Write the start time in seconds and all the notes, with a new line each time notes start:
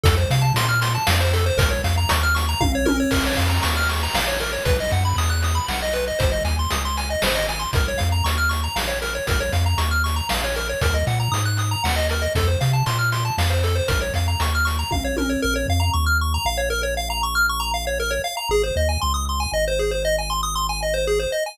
0.03 F2 A4, kick, closed hi-hat
0.17 C5
0.30 C3 F5, closed hi-hat
0.42 A5
0.54 A#2 C6, closed hi-hat
0.69 F6
0.81 C6, closed hi-hat
0.95 A5
1.07 F2 F5, snare
1.20 C5
1.33 A4, closed hi-hat
1.46 C5
1.57 A#1 A#4, kick, closed hi-hat
1.71 C#5
1.84 F2 F5, closed hi-hat
1.97 A#5
2.09 D#2 C#6, closed hi-hat
2.23 F6
2.35 C#6, closed hi-hat
2.49 A#5
2.61 A#1 F5, kick, high tom
2.75 C#5
2.85 A#4, high tom
3.00 C#5
3.11 A#1 A#4, kick, crash
3.26 C#5
3.37 F2 F5, closed hi-hat
3.50 A#5
3.63 D#2 C#6, closed hi-hat
3.77 F6
3.89 C#6, closed hi-hat
4.03 A#5
4.14 A#1 F5, snare
4.28 C#5
4.40 A#4, closed hi-hat
4.53 C#5
4.65 B1 B4, kick, closed hi-hat
4.80 D#5
4.91 F#2 F#5, closed hi-hat
5.05 B5
5.16 E2 D#6, closed hi-hat
5.30 F#6
5.42 D#6, closed hi-hat
5.55 B5
5.68 B1 F#5, snare
5.82 D#5
5.93 B4, closed hi-hat
6.07 D#5
6.19 G#1 C5, kick, closed hi-hat
6.32 D#5
6.45 D#2 G#5, closed hi-hat
6.59 C6
6.70 C#2 D#6, closed hi-hat
6.85 C6
6.97 G#5, closed hi-hat
7.10 D#5
7.22 G#1 C5, snare
7.35 D#5
7.49 G#5, closed hi-hat
7.59 C6
7.73 A#1 A#4, kick, closed hi-hat
7.88 C#5
7.98 F2 F5, closed hi-hat
8.12 A#5
8.24 D#2 C#6, closed hi-hat
8.38 F6
8.49 C#6, closed hi-hat
8.64 A#5
8.76 A#1 F5, snare
8.87 C#5
9.02 A#4, closed hi-hat
9.15 C#5
9.27 A#1 A#4, kick, closed hi-hat
9.40 C#5
9.52 F2 F5, closed hi-hat
9.66 A#5
9.78 D#2 C#6, closed hi-hat
9.91 F6
10.04 C#6, closed hi-hat
10.16 A#5
10.29 A#1 F5, snare
10.44 C#5
10.55 A#4, closed hi-hat
10.69 C#5
10.81 D#2 A#4, kick, closed hi-hat
10.94 D#5
11.07 A#2 F#5, closed hi-hat
11.20 A#5
11.32 G#2 D#6, closed hi-hat
11.45 F#6
11.57 D#6, closed hi-hat
11.71 A#5
11.84 D#2 F#5, snare
11.96 D#5
12.09 A#4, closed hi-hat
12.22 D#5
12.35 F2 A4, kick, closed hi-hat
12.47 C5
12.61 C3 F5, closed hi-hat
12.73 A5
12.86 A#2 C6, closed hi-hat
12.99 F6
13.12 C6, closed hi-hat
13.25 A5
13.38 F2 F5, snare
13.50 C5
13.63 A4, closed hi-hat
13.75 C5
13.88 A#1 A#4, kick, closed hi-hat
14.01 C#5
14.14 F2 F5, closed hi-hat
14.28 A#5
14.40 D#2 C#6, closed hi-hat
14.55 F6
14.65 C#6, closed hi-hat
14.79 A#5
14.91 A#1 F5, kick, high tom
15.04 C#5
15.17 A#4, high tom
15.29 C#5
15.42 A#1 A#4
15.56 C#5
15.68 F2 F5
15.80 A#5
15.93 D#2 C#6
16.06 F6
16.21 C#6
16.34 A#5
16.45 A#1 F5
16.57 C#5
16.70 A#4
16.83 C#5
16.97 F5
17.10 A#5
17.23 C#6
17.35 F6
17.49 C#6
17.60 A#5
17.74 F5
17.87 C#5
18.00 A#4
18.10 C#5
18.24 F5
18.37 A#5
18.49 G#1 G#4
18.63 C5
18.76 D#2 D#5
18.89 G#5
19.01 C#2 C6
19.14 D#6
19.29 C6
19.40 G#5
19.52 G#1 D#5
19.68 C5
19.79 G#4
19.91 C5
20.05 D#5
20.18 G#5
20.30 C6
20.43 D#6
20.55 C6
20.69 G#5
20.82 D#5
20.94 C5
21.07 G#4
21.19 C5
21.32 D#5
21.46 G#5